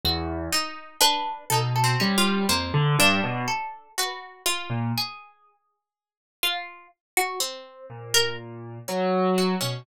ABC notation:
X:1
M:5/8
L:1/16
Q:1/4=61
K:none
V:1 name="Acoustic Grand Piano" clef=bass
E,,2 z4 B,,2 G,2 | F,, D, G,, B,, z5 ^A,, | z10 | z2 ^A,,4 ^F,3 B,, |]
V:2 name="Harpsichord"
^F4 D2 A A ^C2 | ^A,4 =A2 B4 | ^G6 F2 z ^F | C4 z2 ^C3 z |]
V:3 name="Harpsichord"
z2 ^D2 B2 (3D2 C2 F2 | c2 D4 ^F2 =F2 | z10 | z3 ^A z4 ^F ^C |]